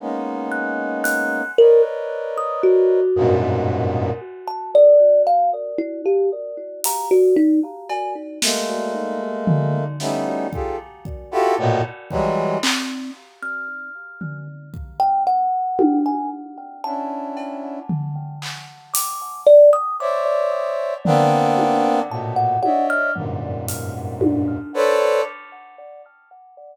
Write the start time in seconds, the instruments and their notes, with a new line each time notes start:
0.00 brass section G#3 A#3 B3 C#4 D#4
0.52 kalimba F#6
1.04 kalimba F#6, closed hi-hat
1.58 brass section A#4 B4 C#5 D5 D#5, kalimba A#4
2.38 kalimba D#6
2.63 kalimba F#4
3.16 brass section F#2 G2 G#2 A#2 B2
4.48 kalimba A5
4.75 kalimba D5
5.27 kalimba F5
5.78 kalimba E4
6.05 kalimba G4
6.84 kalimba A#5, closed hi-hat
7.11 kalimba F#4
7.36 kalimba D#4
7.89 kalimba G#5, cowbell
8.42 brass section G#3 A3 A#3, snare
9.47 floor tom
10.00 brass section G3 A3 B3 C#4 D#4 E4, snare
10.53 brass section F4 G4 G#4 A4, kick
11.05 kick
11.31 brass section E4 F4 F#4 G4 A4
11.58 brass section A2 A#2 B2
12.10 brass section E3 F#3 G3 G#3, kick
12.63 kalimba C4, clap
13.43 kalimba F6
14.21 floor tom
14.74 kick
15.00 kalimba G5
15.27 kalimba F#5
15.79 high tom
16.06 kalimba G#5
16.84 brass section C#4 D4 E4, kalimba A5
17.37 cowbell
17.89 floor tom
18.42 clap
18.94 kalimba D6, closed hi-hat
19.46 kalimba D5
19.73 kalimba D#6
20.00 brass section C5 C#5 D5 E5, kalimba D6
21.05 brass section A#3 B3 C4 D4, floor tom
21.58 high tom
22.10 brass section A2 A#2 B2, kalimba A5
22.36 kalimba F#5
22.63 brass section C#5 D5 D#5 E5, kalimba F#5, high tom
22.90 kalimba F6
23.16 brass section F#2 G2 G#2 A#2, floor tom
23.68 closed hi-hat
24.21 high tom
24.74 brass section A4 B4 C5 C#5 D5